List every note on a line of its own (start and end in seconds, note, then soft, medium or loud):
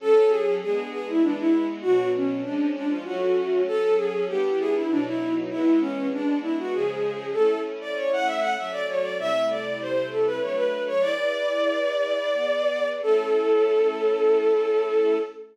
0.00 0.60 F#3 medium
0.00 0.60 C#4 loud
0.00 0.60 A4 loud
0.00 0.30 A4 loud
0.29 0.55 G#4 medium
0.62 1.21 G#3 loud
0.62 1.21 B3 medium
0.62 1.22 D4 medium
0.62 0.89 G#4 medium
0.91 1.06 G#4 medium
1.09 1.23 E4 medium
1.22 1.82 E3 medium
1.22 1.82 G#3 medium
1.22 1.82 B3 medium
1.22 1.37 D4 medium
1.39 1.66 E4 loud
1.82 2.44 B2 medium
1.82 2.44 F#3 medium
1.82 2.44 D4 medium
1.82 2.08 F#4 loud
2.15 2.40 C#4 medium
2.43 3.05 F3 medium
2.43 3.05 G#3 medium
2.43 3.05 C#4 medium
2.43 2.69 D4 medium
2.76 2.90 D4 medium
2.89 3.04 F4 medium
3.04 3.66 F#3 medium
3.04 3.66 A3 medium
3.04 3.66 C#4 loud
3.04 3.62 F#4 medium
3.67 4.28 F#3 medium
3.67 4.28 C#4 loud
3.67 3.94 A4 loud
3.67 4.28 A4 medium
3.96 4.24 G#4 medium
4.28 4.89 G3 medium
4.28 4.89 B3 loud
4.28 4.89 D4 medium
4.28 4.89 E4 medium
4.28 4.57 G4 loud
4.59 4.74 G#4 loud
4.75 4.90 E4 medium
4.89 5.50 B2 medium
4.89 5.50 F#3 medium
4.89 5.05 D4 medium
4.89 5.50 D#4 loud
5.07 5.33 E4 loud
5.50 6.12 E3 medium
5.50 6.12 G#3 medium
5.50 6.12 B3 loud
5.50 5.79 E4 loud
5.81 6.08 C#4 loud
6.13 6.73 G#3 medium
6.13 6.73 B3 medium
6.13 6.73 D4 medium
6.13 6.38 D4 loud
6.42 6.56 E4 medium
6.59 6.73 F#4 medium
6.73 7.34 C#3 medium
6.73 7.34 F3 loud
6.73 7.34 G#3 medium
6.73 7.31 G#4 medium
7.33 8.56 A3 medium
7.33 8.56 C#4 medium
7.33 8.56 E4 medium
7.33 7.59 A4 medium
7.81 7.95 D5 medium
7.96 8.11 C#5 medium
8.13 8.27 F#5 medium
8.26 8.40 E5 medium
8.40 8.54 F#5 medium
8.57 9.18 F#3 medium
8.57 9.17 A3 medium
8.57 9.18 C#4 medium
8.57 8.72 E5 medium
8.72 8.86 D5 loud
8.89 9.03 C#5 medium
9.02 9.17 D5 medium
9.18 10.39 C3 medium
9.18 10.39 G3 medium
9.18 10.39 A3 medium
9.18 10.39 E4 medium
9.18 9.45 E5 loud
9.49 9.78 D5 medium
9.81 10.07 C5 medium
10.11 10.26 A4 medium
10.26 10.40 B4 medium
10.41 11.02 F#3 medium
10.41 11.02 A3 medium
10.41 11.02 D4 medium
10.41 10.56 C#5 medium
10.55 10.83 B4 medium
10.87 11.02 C#5 medium
11.01 12.29 E4 medium
11.01 12.29 G#4 medium
11.01 12.29 B4 medium
11.01 12.88 D5 loud
11.01 12.29 D5 medium
12.32 13.01 B3 medium
12.32 13.01 G#4 medium
12.32 13.01 D5 medium
13.02 15.17 A3 medium
13.02 15.17 C#4 medium
13.02 15.17 E4 medium
13.02 15.17 A4 loud